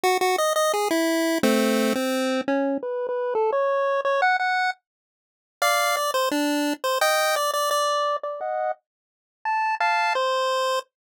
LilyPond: \new Staff { \time 4/4 \key e \major \tempo 4 = 172 fis'8 fis'8 dis''8 dis''8 gis'8 e'4. | <a c'>4. c'4. cis'4 | b'8. b'8. a'8 cis''4. cis''8 | fis''8 fis''4 r2 r8 |
\key bes \major <d'' f''>4 d''8 c''8 d'4. c''8 | <ees'' g''>4 d''8 d''8 d''4. d''8 | <ees'' ges''>4 r2 a''4 | <f'' a''>4 c''2 r4 | }